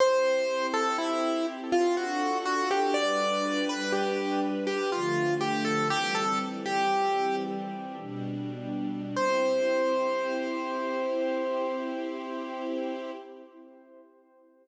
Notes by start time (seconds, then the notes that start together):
0.00 C4 E4 G4 C5
0.74 A4
0.98 E4
1.72 F4
1.97 D4 F#4 A4
2.45 F#4
2.71 G4
2.94 G3 D4 B4 D5
3.69 B4
3.92 G4
4.67 G4
4.92 D3 F3 A3 F4
5.41 G4
5.65 A4
5.89 E3 G3 C4 G4
6.15 A4
6.66 G4
8.00 B2 G3 D4
9.16 C4 E4 G4 C5